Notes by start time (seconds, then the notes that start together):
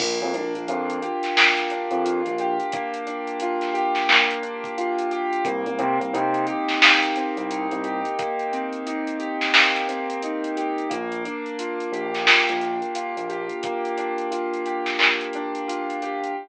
0.00 A#1 A#3, kick, crash
0.22 F2
0.34 A#1 D4, closed hi-hat
0.55 A#1, closed hi-hat
0.68 F2 F4, closed hi-hat
0.90 closed hi-hat
1.02 G4, closed hi-hat
1.23 snare, closed hi-hat
1.36 A#3, snare
1.57 snare, closed hi-hat
1.70 D4, closed hi-hat
1.91 F2, closed hi-hat
2.05 F4, closed hi-hat
2.26 A#1, closed hi-hat
2.38 G4, closed hi-hat
2.60 closed hi-hat
2.72 A#3, kick, closed hi-hat
2.94 closed hi-hat
3.07 D4, closed hi-hat
3.27 closed hi-hat
3.40 F4, closed hi-hat
3.61 snare, closed hi-hat
3.74 G4, closed hi-hat
3.95 snare, closed hi-hat
4.09 A#3, clap
4.31 closed hi-hat
4.42 D4, closed hi-hat
4.64 kick, closed hi-hat
4.78 F4, closed hi-hat
4.99 closed hi-hat
5.11 G4, closed hi-hat
5.33 closed hi-hat
5.45 C2 A#3, kick, closed hi-hat
5.66 C2, closed hi-hat
5.79 C3 C4, closed hi-hat
6.00 C2, closed hi-hat
6.13 C3 D#4, closed hi-hat
6.34 closed hi-hat
6.47 G4, closed hi-hat
6.68 snare, closed hi-hat
6.82 A#3, snare
7.03 closed hi-hat
7.16 C4, closed hi-hat
7.37 C2, closed hi-hat
7.50 D#4, closed hi-hat
7.71 C2, closed hi-hat
7.84 G4, closed hi-hat
8.05 closed hi-hat
8.19 A#3, kick, closed hi-hat
8.39 closed hi-hat
8.52 C4, closed hi-hat
8.73 closed hi-hat
8.87 D#4, closed hi-hat
9.07 closed hi-hat
9.19 G4, closed hi-hat
9.41 snare, closed hi-hat
9.54 A#3, snare
9.76 closed hi-hat
9.88 C4, closed hi-hat
10.10 closed hi-hat
10.22 D#4, closed hi-hat
10.44 closed hi-hat
10.57 G4, closed hi-hat
10.78 closed hi-hat
10.90 A#1 A#3, kick, closed hi-hat
11.12 closed hi-hat
11.25 D4, closed hi-hat
11.46 closed hi-hat
11.59 F4, closed hi-hat
11.80 closed hi-hat
11.92 A#1 G4, closed hi-hat
12.14 snare, closed hi-hat
12.26 A#3, snare
12.49 A#1, closed hi-hat
12.61 D4, closed hi-hat
12.82 closed hi-hat
12.95 F4, closed hi-hat
13.17 A#1, closed hi-hat
13.29 G4, closed hi-hat
13.49 closed hi-hat
13.63 A#3, kick, closed hi-hat
13.85 closed hi-hat
13.98 D4, closed hi-hat
14.18 closed hi-hat
14.31 F4, closed hi-hat
14.54 closed hi-hat
14.66 G4, closed hi-hat
14.86 snare, closed hi-hat
14.99 A#3, clap
15.21 closed hi-hat
15.33 D4, closed hi-hat
15.55 closed hi-hat
15.68 F4, closed hi-hat
15.90 closed hi-hat
16.02 G4, closed hi-hat
16.24 closed hi-hat